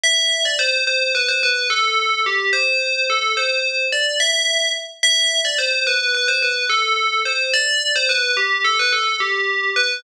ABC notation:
X:1
M:9/8
L:1/16
Q:3/8=72
K:Em
V:1 name="Tubular Bells"
e3 d c2 c2 B c B2 A4 G2 | c4 A2 c4 d2 e4 z2 | e3 d c2 B2 B c B2 A4 c2 | d3 c B2 G2 A B A2 G4 B2 |]